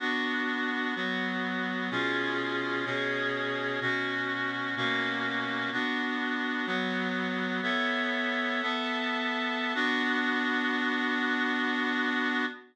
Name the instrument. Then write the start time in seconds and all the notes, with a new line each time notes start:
clarinet
0.00 B3 D4 F#4
0.96 F#3 B3 F#4
1.91 B2 C#4 F4 G#4
2.85 B2 C#4 G#4 C#5
3.81 B2 C#4 F#4
4.76 B2 A#3 C#4 F#4
5.72 B3 D4 F#4
6.66 F#3 B3 F#4
7.62 B3 A4 C#5 E5
8.62 B3 A4 E5 A5
9.75 B3 D4 F#4